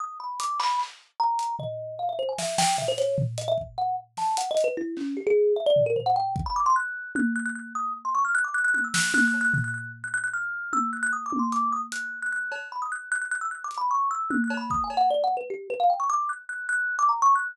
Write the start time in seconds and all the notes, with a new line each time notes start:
0.00 D#6
0.20 B5
0.40 D6, closed hi-hat
0.60 B5, clap
0.79 clap
1.19 A#5
1.39 closed hi-hat
1.59 D#5, floor tom
1.99 F5
2.09 E5
2.19 C5
2.28 G#5
2.38 E5, snare
2.58 G5, snare
2.78 E5, floor tom
2.88 C5
2.98 C#5, closed hi-hat
3.18 floor tom
3.38 D#5, closed hi-hat
3.48 E5
3.58 kick
3.77 F#5
4.17 A5, snare
4.37 F#5, closed hi-hat
4.50 D#5
4.57 closed hi-hat
4.64 B4
4.77 E4
4.97 C#4, clap
5.17 G4
5.26 G#4
5.56 E5
5.66 D5
5.76 floor tom
5.86 A#4
5.96 C5, floor tom
6.06 F#5
6.16 G5
6.36 kick
6.46 B5
6.56 D6
6.66 C6
6.75 F#6
7.15 F#6, high tom
7.35 F#6
7.45 F#6
7.55 F#6
7.75 D#6
8.05 C6
8.15 C#6
8.25 F6
8.35 F#6
8.44 D6
8.54 F#6
8.64 F#6
8.74 F#6, high tom
8.84 E6
8.94 F#6, snare
9.14 F#6, high tom
9.27 F#6
9.34 cowbell
9.40 F#6
9.54 F#6, floor tom
9.64 F#6
9.73 F#6
10.03 F#6
10.13 F#6
10.23 F#6
10.33 F6
10.73 E6, high tom
10.93 F#6
11.03 F#6
11.13 D#6
11.26 D6
11.32 high tom
11.39 C6
11.52 D6, closed hi-hat
11.72 D#6
11.92 F#6, closed hi-hat
12.22 F#6
12.32 F#6
12.52 cowbell
12.72 B5
12.81 D#6
12.91 F#6
13.11 F#6
13.21 F#6
13.31 F#6
13.41 E6
13.51 F#6
13.64 D6
13.71 closed hi-hat
13.77 B5
13.91 C#6
14.11 E6
14.30 F#6, high tom
14.44 F#6
14.50 cowbell
14.57 B5
14.70 D#6, kick
14.83 G#5
14.90 cowbell
14.97 F#5
15.10 D5
15.23 F#5
15.36 B4
15.50 G4
15.70 B4
15.79 F5
15.89 G5
15.99 C#6
16.09 D6
16.29 F#6
16.49 F#6
16.69 F#6
16.99 D6
17.09 A#5
17.22 C#6
17.35 F#6